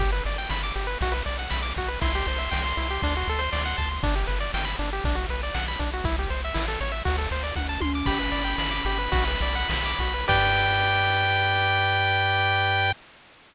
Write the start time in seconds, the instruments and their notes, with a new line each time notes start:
0.00 synth bass 1 G1, lead 1 (square) G4, kick, crash
0.12 lead 1 (square) B4
0.25 synth bass 1 G1, lead 1 (square) D5, ride
0.38 lead 1 (square) G5
0.49 synth bass 1 G1, lead 1 (square) B5, snare
0.63 lead 1 (square) D6
0.76 synth bass 1 G1, lead 1 (square) G4, ride
0.87 lead 1 (square) B4
1.01 synth bass 1 B1, lead 1 (square) F#4, kick, ride
1.12 lead 1 (square) B4
1.26 synth bass 1 B1, lead 1 (square) D5, ride
1.39 lead 1 (square) F#5
1.50 synth bass 1 B1, lead 1 (square) B5, snare
1.63 lead 1 (square) D6
1.76 synth bass 1 B1, lead 1 (square) F#4, kick, ride
1.88 lead 1 (square) B4
2.01 synth bass 1 C2, lead 1 (square) E4 C6, kick, ride
2.15 lead 1 (square) G4
2.27 synth bass 1 C2, lead 1 (square) C5, ride
2.38 lead 1 (square) E5
2.51 synth bass 1 C2, lead 1 (square) G5, snare
2.65 lead 1 (square) C6
2.77 synth bass 1 C2, lead 1 (square) E4, ride
2.90 lead 1 (square) G4
3.02 synth bass 1 D2, lead 1 (square) D4, kick, ride
3.17 lead 1 (square) F#4
3.28 synth bass 1 D2, lead 1 (square) A4, ride
3.39 lead 1 (square) C5
3.52 synth bass 1 D2, lead 1 (square) D5, snare
3.65 lead 1 (square) F#5
3.78 synth bass 1 D2, lead 1 (square) A5, kick, ride
3.91 lead 1 (square) C6
4.03 synth bass 1 G1, lead 1 (square) D4, kick, ride
4.15 lead 1 (square) G4
4.27 synth bass 1 G1, lead 1 (square) B4, ride
4.40 lead 1 (square) D5
4.54 synth bass 1 G1, lead 1 (square) G5, snare
4.65 lead 1 (square) B5
4.79 synth bass 1 G1, lead 1 (square) D4, ride
4.93 lead 1 (square) G4
5.04 synth bass 1 B1, lead 1 (square) D4, kick, ride
5.15 lead 1 (square) F#4
5.28 synth bass 1 B1, lead 1 (square) B4, ride
5.43 lead 1 (square) D5
5.54 synth bass 1 B1, lead 1 (square) F#5, snare
5.68 lead 1 (square) B5
5.79 synth bass 1 B1, lead 1 (square) D4, kick, ride
5.93 lead 1 (square) F#4
6.04 synth bass 1 C2, lead 1 (square) E4, kick, ride
6.19 lead 1 (square) G4
6.29 synth bass 1 C2, lead 1 (square) C5, ride
6.45 lead 1 (square) E5
6.54 synth bass 1 A1, lead 1 (square) E4, snare
6.68 lead 1 (square) A4
6.81 synth bass 1 A1, lead 1 (square) C#5, ride
6.92 lead 1 (square) E5
7.05 synth bass 1 D2, lead 1 (square) F#4, kick, ride
7.18 lead 1 (square) A4
7.30 synth bass 1 D2, lead 1 (square) C5, ride
7.44 lead 1 (square) D5
7.55 synth bass 1 D2, lead 1 (square) F#5, kick, high tom
7.69 lead 1 (square) A5
7.80 synth bass 1 D2, lead 1 (square) C6, high tom
7.95 lead 1 (square) D6
8.06 synth bass 1 G1, lead 1 (square) G4 B5, kick, crash
8.19 lead 1 (square) B4
8.32 synth bass 1 G1, lead 1 (square) D5, ride
8.44 lead 1 (square) G5
8.58 synth bass 1 G1, lead 1 (square) B5, snare
8.71 lead 1 (square) D6
8.85 synth bass 1 G1, lead 1 (square) G4, ride
8.98 lead 1 (square) B4
9.12 synth bass 1 B1, lead 1 (square) F#4, kick, ride
9.28 lead 1 (square) B4
9.41 synth bass 1 B1, lead 1 (square) D5, ride
9.55 lead 1 (square) F#5
9.68 synth bass 1 B1, lead 1 (square) B5, snare
9.86 lead 1 (square) D6
9.99 synth bass 1 B1, lead 1 (square) F#4, kick, ride
10.14 lead 1 (square) B4
10.28 synth bass 1 G2, lead 1 (square) G4 B4 D5 G5, kick, crash